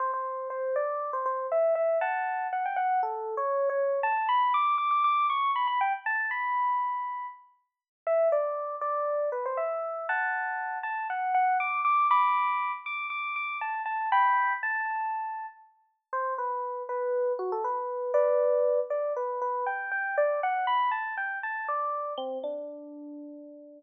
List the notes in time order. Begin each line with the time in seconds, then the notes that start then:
0.00 C5
0.14 C5
0.50 C5
0.76 D5
1.13 C5
1.26 C5
1.52 E5
1.75 E5
2.01 F#5 A5
2.53 F#5
2.66 G5
2.76 F#5
3.03 A4
3.37 C#5
3.69 C#5
4.03 A5
4.29 B5
4.54 D6
4.78 D6
4.91 D6
5.04 D6
5.30 C#6
5.56 B5
5.67 B5
5.81 G5
6.06 A5
6.31 B5
8.07 E5
8.32 D5
8.81 D5
9.32 B4
9.46 C5
9.57 E5
10.09 F#5 A5
10.83 A5
11.10 F#5
11.34 F#5
11.60 D6
11.85 D6
12.11 B5 D6
12.86 D6
13.10 D6
13.36 D6
13.61 A5
13.86 A5
14.12 G5 B5
14.63 A5
16.13 C5
16.38 B4
16.89 B4
17.39 F#4
17.52 A4
17.64 B4
18.14 B4 D5
18.90 D5
19.16 B4
19.42 B4
19.66 G5
19.91 G5
20.18 D5
20.43 F#5
20.67 B5
20.91 A5
21.17 G5
21.43 A5
21.68 D5
22.18 C4
22.44 D4